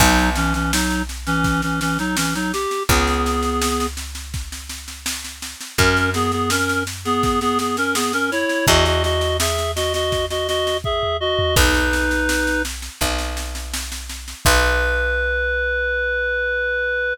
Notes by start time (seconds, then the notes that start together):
0.00 B1 F#3 D#4, kick, snare, crash
0.18 snare
0.36 E3 C#4, snare
0.54 E3 C#4, snare
0.72 F#3 D#4, snare
0.91 snare
1.09 snare
1.27 E3 C#4, snare
1.44 kick, snare
1.62 E3 C#4, snare
1.81 E3 C#4, snare
1.99 F#3 D#4, snare
2.17 E3 C#4, snare
2.35 F#3 D#4, snare
2.53 G4, snare
2.71 snare
2.89 C#2 B3 G#4, kick, snare
3.07 snare
3.26 snare
3.43 snare
3.62 snare
3.80 snare
3.97 snare
4.15 snare
4.34 kick, snare
4.52 snare
4.69 snare
4.88 snare
5.06 snare
5.25 snare
5.42 snare
5.61 snare
5.78 F#2 C#4 A#4, kick, snare
5.97 snare
6.14 B3 G#4, snare
6.32 B3 G#4, snare
6.50 C#4 A#4, snare
6.69 snare
6.87 snare
7.05 B3 G#4, snare
7.23 kick, snare
7.41 B3 G#4, snare
7.59 B3 G#4, snare
7.77 C#4 A#4, snare
7.95 B3 G#4, snare
8.13 C#4 A#4, snare
8.31 E4 C#5, snare
8.49 snare
8.67 E2 F#4 D#5, kick, snare
8.86 F#4 D#5, snare
9.04 F#4 D#5, snare
9.21 snare
9.40 G#4 E5, snare
9.58 snare
9.76 F#4 D#5, snare
9.94 F#4 D#5, snare
10.12 kick, snare
10.30 F#4 D#5, snare
10.48 F#4 D#5, snare
10.67 snare
10.84 G#4 E5, kick
11.03 floor tom
11.20 F#4 D#5
11.39 floor tom
11.56 B1 D#4 B4, kick, snare, crash
11.74 snare
11.93 snare
12.11 snare
12.29 snare
12.47 snare
12.65 snare
12.82 snare
13.01 B1, kick, snare
13.19 snare
13.37 snare
13.55 snare
13.73 snare
13.92 snare
14.09 snare
14.28 snare
14.45 B1 B4, kick, crash